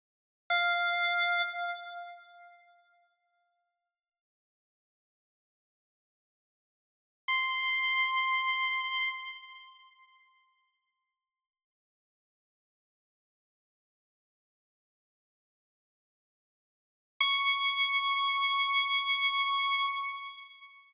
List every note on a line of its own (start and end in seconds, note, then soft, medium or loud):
0.50 1.42 F5 medium
7.28 9.09 C6 medium
17.20 19.86 C#6 loud